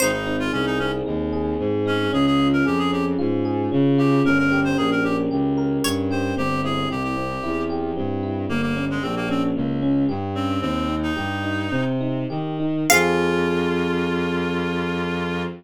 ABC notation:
X:1
M:4/4
L:1/16
Q:1/4=113
K:Fm
V:1 name="Harpsichord"
c16 | z16 | z12 d4 | z16 |
z16 | "^rit." z16 | f16 |]
V:2 name="Clarinet"
E E2 F D E D z7 D2 | A A2 B G A G z7 G2 | B B2 c A B G z7 c2 | G2 A2 G G5 z6 |
B, B,2 A, C B, C z7 C2 | "^rit." C3 E7 z6 | F16 |]
V:3 name="Electric Piano 1"
C2 E2 A2 C2 E2 A2 C2 E2 | D2 F2 A2 D2 F2 A2 D2 F2 | D2 G2 B2 D2 G2 B2 D2 G2 | C2 =E2 G2 C2 E2 G2 C2 E2 |
B,2 D2 G2 D2 B,2 D2 G2 D2 | "^rit." C2 E2 G2 E2 C2 E2 G2 E2 | [CFA]16 |]
V:4 name="Violin" clef=bass
A,,,4 C,,4 E,,4 A,,4 | D,,4 F,,4 A,,4 D,4 | G,,,4 B,,,4 D,,4 G,,4 | G,,,4 C,,4 =E,,4 G,,4 |
G,,,4 B,,,4 D,,4 G,,4 | "^rit." E,,4 G,,4 C,4 E,4 | F,,16 |]